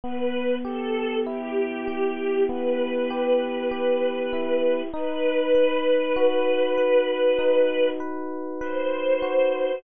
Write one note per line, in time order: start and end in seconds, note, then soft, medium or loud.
0.03 2.48 B3 medium
0.03 0.55 B4 medium
0.65 1.87 G4 medium
0.65 1.19 A4 loud
1.26 4.32 E4 medium
1.26 2.43 G4 medium
1.88 3.10 G4 medium
2.49 4.82 B3 medium
2.49 4.81 B4 medium
3.10 3.71 G4 medium
3.71 4.88 G4 medium
4.33 4.91 E4 medium
4.93 7.38 D#4 medium
4.93 7.89 B4 loud
5.55 6.77 B4 medium
6.16 9.22 F#4 medium
6.77 7.99 B4 medium
7.39 9.71 D#4 medium
8.00 8.60 B4 medium
8.61 9.77 B4 medium
8.61 9.78 C5 medium
9.22 9.80 F#4 medium